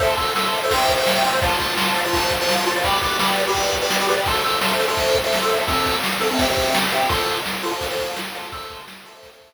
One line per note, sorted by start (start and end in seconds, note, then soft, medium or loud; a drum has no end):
0.00 0.14 A4 loud
0.00 0.14 C5 loud
0.00 0.14 E5 loud
0.00 kick medium
0.00 crash medium
0.17 0.31 A4 medium
0.17 0.31 C5 medium
0.17 0.31 E5 medium
0.17 kick medium
0.17 ride medium
0.35 0.43 A4 medium
0.35 0.43 C5 medium
0.35 0.43 E5 loud
0.35 snare medium
0.44 0.59 A4 medium
0.44 0.59 C5 medium
0.44 0.59 E5 medium
0.53 ride medium
0.63 0.70 A4 medium
0.63 0.70 C5 loud
0.63 0.70 E5 medium
0.71 0.92 C5 loud
0.71 0.92 E5 loud
0.71 0.92 G5 loud
0.71 kick medium
0.71 ride loud
0.89 kick medium
0.89 ride medium
0.97 1.11 C5 medium
0.97 1.11 E5 loud
0.97 1.11 G5 medium
1.07 snare loud
1.15 1.22 C5 medium
1.15 1.22 E5 medium
1.15 1.22 G5 loud
1.24 1.31 C5 loud
1.24 1.31 E5 medium
1.24 1.31 G5 loud
1.24 ride medium
1.33 1.40 C5 loud
1.33 1.40 E5 medium
1.33 1.40 G5 medium
1.42 1.57 F4 loud
1.42 1.57 C5 loud
1.42 1.57 A5 loud
1.42 kick loud
1.42 ride loud
1.60 1.74 F4 medium
1.60 1.74 C5 medium
1.60 1.74 A5 medium
1.60 kick medium
1.60 ride medium
1.78 1.85 F4 medium
1.78 1.85 C5 medium
1.78 1.85 A5 medium
1.78 snare loud
1.86 2.00 F4 medium
1.86 2.00 C5 medium
1.86 2.00 A5 medium
1.95 ride medium
2.05 2.33 F4 medium
2.05 2.33 C5 medium
2.05 2.33 A5 medium
2.13 kick medium
2.13 ride loud
2.31 kick medium
2.31 ride medium
2.41 2.55 F4 loud
2.41 2.55 C5 medium
2.41 2.55 A5 loud
2.49 snare loud
2.57 2.64 F4 medium
2.57 2.64 C5 loud
2.57 2.64 A5 medium
2.66 2.74 F4 medium
2.66 2.74 C5 medium
2.66 2.74 A5 loud
2.66 ride medium
2.76 2.83 F4 loud
2.76 2.83 C5 loud
2.76 2.83 A5 medium
2.84 2.99 G4 loud
2.84 2.99 B4 loud
2.84 2.99 D5 loud
2.84 kick medium
2.84 ride loud
3.02 3.17 G4 medium
3.02 3.17 B4 medium
3.02 3.17 D5 medium
3.02 kick medium
3.02 ride medium
3.19 3.27 G4 medium
3.19 3.27 B4 medium
3.19 3.27 D5 loud
3.19 snare loud
3.27 3.42 G4 medium
3.27 3.42 B4 medium
3.27 3.42 D5 medium
3.37 ride medium
3.47 3.76 G4 medium
3.47 3.76 B4 medium
3.47 3.76 D5 medium
3.55 kick medium
3.55 ride medium
3.73 kick medium
3.73 ride medium
3.82 3.96 G4 medium
3.82 3.96 B4 loud
3.82 3.96 D5 medium
3.90 snare loud
4.00 4.07 G4 loud
4.00 4.07 B4 medium
4.00 4.07 D5 medium
4.08 4.15 G4 medium
4.08 4.15 B4 medium
4.08 4.15 D5 loud
4.08 ride medium
4.18 4.25 G4 medium
4.18 4.25 B4 medium
4.18 4.25 D5 medium
4.26 4.41 A4 loud
4.26 4.41 C5 loud
4.26 4.41 E5 loud
4.26 kick loud
4.26 ride loud
4.44 4.58 A4 medium
4.44 4.58 C5 loud
4.44 4.58 E5 loud
4.44 ride medium
4.61 4.69 A4 medium
4.61 4.69 C5 medium
4.61 4.69 E5 medium
4.61 snare loud
4.69 4.83 A4 medium
4.69 4.83 C5 medium
4.69 4.83 E5 medium
4.80 ride medium
4.88 5.16 A4 medium
4.88 5.16 C5 loud
4.88 5.16 E5 loud
4.97 kick medium
4.97 ride medium
5.15 kick medium
5.15 ride medium
5.24 5.38 A4 medium
5.24 5.38 C5 medium
5.24 5.38 E5 loud
5.33 snare medium
5.42 5.49 A4 medium
5.42 5.49 C5 medium
5.42 5.49 E5 loud
5.50 5.57 A4 medium
5.50 5.57 C5 medium
5.50 5.57 E5 loud
5.50 ride medium
5.58 5.65 A4 medium
5.58 5.65 C5 medium
5.58 5.65 E5 medium
5.67 5.96 C4 loud
5.67 5.96 A4 loud
5.67 5.96 E5 loud
5.67 kick loud
5.67 ride loud
5.86 kick medium
5.86 ride medium
6.04 snare loud
6.20 6.28 C4 loud
6.20 6.28 A4 medium
6.20 6.28 E5 medium
6.20 ride medium
6.31 6.38 C4 medium
6.31 6.38 A4 loud
6.31 6.38 E5 medium
6.39 6.46 C4 loud
6.39 6.46 G4 loud
6.39 6.46 E5 loud
6.39 kick loud
6.39 ride loud
6.49 6.77 C4 medium
6.49 6.77 G4 loud
6.49 6.77 E5 medium
6.57 kick medium
6.57 ride medium
6.74 snare loud
6.92 7.06 C4 medium
6.92 7.06 G4 loud
6.92 7.06 E5 medium
6.92 ride medium
7.09 7.37 F4 loud
7.09 7.37 A4 loud
7.09 7.37 C5 loud
7.09 kick loud
7.09 ride loud
7.28 ride medium
7.46 snare loud
7.63 7.70 F4 medium
7.63 7.70 A4 loud
7.63 7.70 C5 loud
7.63 ride medium
7.71 7.85 F4 medium
7.71 7.85 A4 medium
7.71 7.85 C5 medium
7.81 kick medium
7.81 ride loud
7.90 8.19 F4 medium
7.90 8.19 A4 medium
7.90 8.19 C5 loud
7.99 kick medium
7.99 ride medium
8.16 snare loud
8.34 8.49 F4 loud
8.34 8.49 A4 loud
8.34 8.49 C5 medium
8.34 ride medium
8.52 8.81 A4 loud
8.52 8.81 C5 loud
8.52 8.81 E5 loud
8.52 kick loud
8.52 ride medium
8.70 kick medium
8.70 ride medium
8.88 snare loud
9.05 9.13 A4 loud
9.05 9.13 C5 medium
9.05 9.13 E5 medium
9.05 ride medium
9.14 9.28 A4 loud
9.14 9.28 C5 medium
9.14 9.28 E5 medium
9.23 kick medium
9.23 ride loud
9.33 9.54 A4 medium
9.33 9.54 C5 medium
9.33 9.54 E5 medium
9.41 kick medium
9.41 ride medium